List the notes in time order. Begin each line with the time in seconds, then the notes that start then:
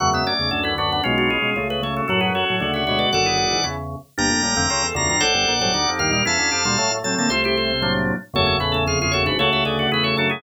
0.00 E2 F#2 C#3 F#3 A3 F#5
0.13 G#3 B3 E5
0.27 A3 C#4 D5
0.39 E2 C#3
0.51 D2 F#2 D3 A4
0.63 C#4 E4 B4
0.78 F#2 D3 D4 F#4 B4
0.92 B3 D4
1.04 B1 B2 G#3 C#4 F4
1.18 D4 F#4
1.30 F4 G#4
1.42 B2 G#3
1.56 C#2 C#3 A3
1.70 G#4 B4
1.82 C#3 A3 A4 C#5
1.97 F#4 A4
2.08 F#2 A2 F#3 F#4 A4
2.21 F#4 G#4 B4
2.35 F#4 A4 C#5
2.50 A2 F#3
2.60 D2 C#3 D3 A3 F#4
2.74 F#4 C#5 E5
2.87 B2 G#3 F#4 C#5 E5
2.99 B4 D5
3.13 F#1 F#2 D3 F#4 A4 D5 F#5
3.26 E4 G#4
3.38 E4 G#4
3.50 G#2 E3
3.64 E2 C#3 C#4 E4
4.18 G1 G2 A#3 D4 G5 A#5
4.30 F1 F2
4.42 A1 A2 G3 A#3
4.55 F1 F2 D3 A3 C4
4.70 C#2 C#3 F4 A4
4.83 E2 E3
4.95 D2 E2 C#3 D3 D4 F4 A#5
5.09 G2 E3 A#5
5.20 A1 A2 A4 C5 D5 F#5
5.34 G1 G2
5.48 A#1 A#2
5.60 G1 G2 A2 F#3 A4 C5
5.74 D2 D3 D#4 G4
5.88 F2 F3
5.99 D#2 G2 D#3 G4 A#4 F5
6.11 A#2 G3 F5
6.25 E2 E3 C#4 E4 F5 A5
6.39 D2 D3
6.52 F2 F3 E4 G4
6.65 D2 A#2 D3 G3 D4 F4
6.78 A2 F#3 A3
6.91 A2 A3
7.04 A2 F#3 A3 C4 A5
7.18 D3 A#3 A5
7.29 C2 C3 A3 F4 A4 C5
7.44 E4 G4 C5
7.57 F4 A4
7.82 A2 F#3 A#3 D4
8.34 F#1 E2 F#2 C#3 F#3 A3 A4 C#5
8.47 A3 C#4
8.60 A1 A2 C#4 E4 B4
8.72 A1 A2 A3 C#4 A4
8.87 F1 F2 F4 G#4 F5
9.02 F4 G#4 F5
9.11 F#1 F#2 F#4 A4 C#5
9.26 G#1 G#2 D4 F#4 B4
9.39 C#2 C#3 A3 F#4 A4 C#5
9.53 C#2 C#3 C#5 E5
9.65 D2 D3 G#4 B4 D5
9.79 F#4
9.92 E2 E3 E4 G#4 B4
10.04 F#4 A4 C#5
10.17 F#2 F#3 D4 F#4 A4
10.30 E4 G#4